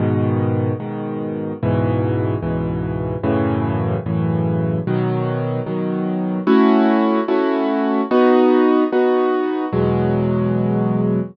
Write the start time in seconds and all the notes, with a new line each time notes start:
0.00 G#2 B2 D#3
0.80 G#2 B2 D#3
1.63 C#2 G#2 B2 E3
2.42 C#2 G#2 B2 E3
3.23 F#2 A2 C#3 E3
4.06 F#2 A2 C#3 E3
4.87 B2 D#3 F#3
5.66 B2 D#3 F#3
6.47 A3 C#4 E4 F#4
7.28 A3 C#4 E4 F#4
8.11 B3 D#4 F#4
8.92 B3 D#4 F#4
9.73 E2 B2 F#3 G#3